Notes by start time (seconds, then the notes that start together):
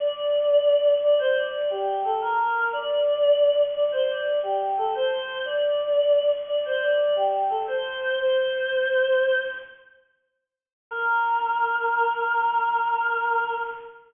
0.00 D5
1.02 D5
1.19 C5
1.36 D5
1.70 G4
2.04 A4
2.21 A#4
2.73 D5
3.75 D5
3.92 C5
4.09 D5
4.43 G4
4.78 A4
4.95 C5
5.45 D5
6.48 D5
6.65 C5
6.82 D5
7.16 G4
7.50 A4
7.67 C5
8.18 C5
10.91 A#4